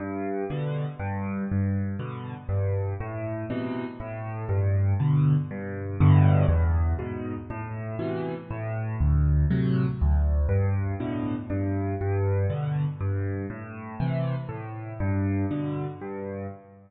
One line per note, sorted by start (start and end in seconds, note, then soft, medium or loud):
0.00 0.44 G2 medium
0.50 0.85 B2 medium
0.50 0.85 D3 medium
0.99 1.44 G2 medium
1.51 1.96 G2 medium
1.99 2.34 B2 medium
1.99 2.34 D3 medium
2.49 2.94 G2 medium
3.00 3.45 A2 medium
3.50 3.85 B2 medium
3.50 3.85 C3 medium
3.50 3.85 E3 medium
4.00 4.45 A2 medium
4.49 4.94 G2 medium
5.00 5.35 B2 medium
5.00 5.35 D3 medium
5.51 5.96 G2 medium
6.00 6.45 G2 medium
6.00 6.45 A2 medium
6.00 6.45 B2 medium
6.00 6.45 D3 medium
6.49 6.94 E2 medium
6.99 7.34 G#2 medium
6.99 7.34 B2 medium
7.50 7.95 A2 medium
7.99 8.34 B2 medium
7.99 8.34 C3 medium
7.99 8.34 E3 medium
8.51 8.96 A2 medium
9.00 9.45 D2 medium
9.51 9.86 A2 medium
9.51 9.86 C3 medium
9.51 9.86 F#3 medium
10.01 10.46 D2 medium
10.49 10.94 G2 medium
11.00 11.35 A2 medium
11.00 11.35 B2 medium
11.00 11.35 D3 medium
11.50 11.95 G2 medium
12.01 12.46 G2 medium
12.50 12.85 B2 medium
12.50 12.85 D3 medium
13.01 13.46 G2 medium
13.50 13.95 A2 medium
14.00 14.35 C3 medium
14.00 14.35 E3 medium
14.49 14.94 A2 medium
15.00 15.45 G2 medium
15.51 15.86 B2 medium
15.51 15.86 D3 medium
16.01 16.46 G2 medium